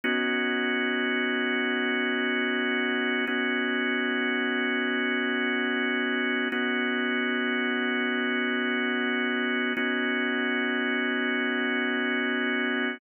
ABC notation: X:1
M:4/4
L:1/8
Q:1/4=74
K:Bmix
V:1 name="Drawbar Organ"
[B,CDF]8 | [B,CDF]8 | [B,CDF]8 | [B,CDF]8 |]